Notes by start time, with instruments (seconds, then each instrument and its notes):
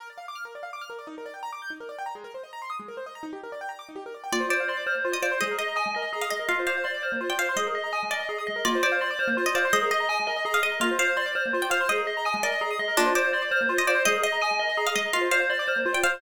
0.00 acoustic grand piano A#4
0.10 acoustic grand piano D5
0.18 acoustic grand piano F5
0.28 acoustic grand piano D6
0.35 acoustic grand piano F6
0.45 acoustic grand piano A#4
0.55 acoustic grand piano D5
0.63 acoustic grand piano F5
0.73 acoustic grand piano D6
0.81 acoustic grand piano F6
0.90 acoustic grand piano A#4
0.99 acoustic grand piano D5
1.07 acoustic grand piano D#4
1.18 acoustic grand piano A#4
1.26 acoustic grand piano D5
1.34 acoustic grand piano G5
1.43 acoustic grand piano A#5
1.53 acoustic grand piano D6
1.62 acoustic grand piano G6
1.70 acoustic grand piano D#4
1.80 acoustic grand piano A#4
1.89 acoustic grand piano D5
1.98 acoustic grand piano G5
2.06 acoustic grand piano A#5
2.15 acoustic grand piano G#3
2.24 acoustic grand piano A#4
2.34 acoustic grand piano C5
2.43 acoustic grand piano D#5
2.53 acoustic grand piano A#5
2.62 acoustic grand piano C6
2.70 acoustic grand piano D#6
2.79 acoustic grand piano G#3
2.88 acoustic grand piano A#4
2.97 acoustic grand piano C5
3.06 acoustic grand piano D#5
3.15 acoustic grand piano A#5
3.23 acoustic grand piano D#4
3.33 acoustic grand piano G4
3.43 acoustic grand piano A#4
3.52 acoustic grand piano D5
3.61 acoustic grand piano G5
3.69 acoustic grand piano A#5
3.79 acoustic grand piano D6
3.89 acoustic grand piano D#4
3.96 acoustic grand piano G4
4.06 acoustic grand piano A#4
4.14 acoustic grand piano D5
4.24 acoustic grand piano G5
4.32 acoustic grand piano A#3, tubular bells F4, pizzicato strings D5
4.40 acoustic grand piano C5
4.49 tubular bells C5, acoustic grand piano D5, pizzicato strings D5
4.60 acoustic grand piano F5
4.68 tubular bells D5, acoustic grand piano C6
4.77 acoustic grand piano D6
4.86 tubular bells C5, acoustic grand piano F6
4.95 acoustic grand piano A#3
5.05 tubular bells F4, acoustic grand piano C5
5.12 acoustic grand piano D5, pizzicato strings D#5
5.22 tubular bells C5, pizzicato strings D5, acoustic grand piano F5
5.32 acoustic grand piano C6
5.41 acoustic grand piano G#3, tubular bells G#4, pizzicato strings D#5
5.51 acoustic grand piano A#4
5.58 tubular bells D#5, pizzicato strings D#5, acoustic grand piano D#5
5.68 acoustic grand piano A#5
5.76 tubular bells G#5, acoustic grand piano D#6
5.86 acoustic grand piano G#3
5.94 acoustic grand piano A#4, tubular bells D#5
6.02 acoustic grand piano D#5
6.13 tubular bells G#4, acoustic grand piano A#5
6.21 pizzicato strings F5, acoustic grand piano D#6
6.30 acoustic grand piano G#3, pizzicato strings D#5, tubular bells D#5
6.39 acoustic grand piano A#4
6.49 acoustic grand piano A#3, tubular bells F4, pizzicato strings F5
6.59 acoustic grand piano C5
6.67 tubular bells C5, acoustic grand piano D5, pizzicato strings F5
6.77 acoustic grand piano F5
6.84 tubular bells D5, acoustic grand piano C6
6.94 acoustic grand piano D6
7.03 tubular bells C5, acoustic grand piano F6
7.12 acoustic grand piano A#3
7.21 tubular bells F4, acoustic grand piano C5
7.30 acoustic grand piano D5, pizzicato strings G5
7.39 tubular bells C5, pizzicato strings F5, acoustic grand piano F5
7.49 acoustic grand piano C6
7.56 acoustic grand piano G#3, tubular bells G#4, pizzicato strings D#5
7.67 acoustic grand piano A#4
7.75 tubular bells D#5, acoustic grand piano D#5
7.84 acoustic grand piano A#5
7.93 tubular bells G#5, acoustic grand piano D#6
8.03 acoustic grand piano G#3
8.11 acoustic grand piano A#4, pizzicato strings D5, tubular bells D#5
8.20 acoustic grand piano D#5
8.29 tubular bells G#4, acoustic grand piano A#5
8.38 acoustic grand piano D#6
8.47 acoustic grand piano G#3, tubular bells D#5
8.56 acoustic grand piano A#4
8.65 acoustic grand piano A#3, tubular bells F4, pizzicato strings D5
8.75 acoustic grand piano C5
8.83 tubular bells C5, acoustic grand piano D5, pizzicato strings D5
8.92 acoustic grand piano F5
9.01 tubular bells D5, acoustic grand piano C6
9.11 acoustic grand piano D6
9.19 tubular bells C5, acoustic grand piano F6
9.28 acoustic grand piano A#3
9.37 tubular bells F4, acoustic grand piano C5
9.46 acoustic grand piano D5, pizzicato strings D#5
9.55 tubular bells C5, pizzicato strings D5, acoustic grand piano F5
9.65 acoustic grand piano C6
9.73 acoustic grand piano G#3, tubular bells G#4, pizzicato strings D#5
9.82 acoustic grand piano A#4
9.91 tubular bells D#5, pizzicato strings D#5, acoustic grand piano D#5
10.00 acoustic grand piano A#5
10.09 tubular bells G#5, acoustic grand piano D#6
10.20 acoustic grand piano G#3
10.27 acoustic grand piano A#4, tubular bells D#5
10.36 acoustic grand piano D#5
10.45 tubular bells G#4, acoustic grand piano A#5
10.54 pizzicato strings F5, acoustic grand piano D#6
10.63 acoustic grand piano G#3, tubular bells D#5, pizzicato strings D#5
10.72 acoustic grand piano A#4
10.80 acoustic grand piano A#3, tubular bells F4, pizzicato strings F5
10.91 acoustic grand piano C5
10.99 tubular bells C5, acoustic grand piano D5, pizzicato strings F5
11.08 acoustic grand piano F5
11.17 tubular bells D5, acoustic grand piano C6
11.26 acoustic grand piano D6
11.35 tubular bells C5, acoustic grand piano F6
11.46 acoustic grand piano A#3
11.53 tubular bells F4, acoustic grand piano C5
11.62 acoustic grand piano D5, pizzicato strings G5
11.70 tubular bells C5, acoustic grand piano F5, pizzicato strings F5
11.81 acoustic grand piano C6
11.89 acoustic grand piano G#3, tubular bells G#4, pizzicato strings D#5
11.97 acoustic grand piano A#4
12.07 acoustic grand piano D#5, tubular bells D#5
12.17 acoustic grand piano A#5
12.25 tubular bells G#5, acoustic grand piano D#6
12.34 acoustic grand piano G#3
12.43 acoustic grand piano A#4, pizzicato strings D5, tubular bells D#5
12.52 acoustic grand piano D#5
12.61 tubular bells G#4, acoustic grand piano A#5
12.71 acoustic grand piano D#6
12.79 acoustic grand piano G#3, tubular bells D#5
12.88 acoustic grand piano A#4
12.97 acoustic grand piano A#3, pizzicato strings D4, tubular bells F4
13.06 acoustic grand piano C5
13.15 tubular bells C5, acoustic grand piano D5, pizzicato strings D5
13.25 acoustic grand piano F5
13.33 tubular bells D5, acoustic grand piano C6
13.42 acoustic grand piano D6
13.51 tubular bells C5, acoustic grand piano F6
13.61 acoustic grand piano A#3
13.69 tubular bells F4, acoustic grand piano C5
13.77 acoustic grand piano D5, pizzicato strings D#5
13.87 tubular bells C5, pizzicato strings D5, acoustic grand piano F5
13.95 acoustic grand piano C6
14.05 acoustic grand piano G#3, tubular bells G#4, pizzicato strings D#5
14.15 acoustic grand piano A#4
14.23 acoustic grand piano D#5, tubular bells D#5, pizzicato strings D#5
14.32 acoustic grand piano A#5
14.41 tubular bells G#5, acoustic grand piano D#6
14.51 acoustic grand piano G#3
14.59 acoustic grand piano A#4, tubular bells D#5
14.69 acoustic grand piano D#5
14.77 tubular bells G#4, acoustic grand piano A#5
14.87 pizzicato strings F5, acoustic grand piano D#6
14.96 acoustic grand piano G#3, pizzicato strings D#5, tubular bells D#5
15.06 acoustic grand piano A#4
15.13 acoustic grand piano A#3, tubular bells F4, pizzicato strings F5
15.21 acoustic grand piano C5
15.31 tubular bells C5, acoustic grand piano D5, pizzicato strings F5
15.40 acoustic grand piano F5
15.50 tubular bells D5, acoustic grand piano C6
15.59 acoustic grand piano D6
15.68 tubular bells C5, acoustic grand piano F6
15.76 acoustic grand piano A#3
15.86 tubular bells F4, acoustic grand piano C5
15.93 acoustic grand piano D5, pizzicato strings G5
16.03 tubular bells C5, acoustic grand piano F5, pizzicato strings F5
16.14 acoustic grand piano C6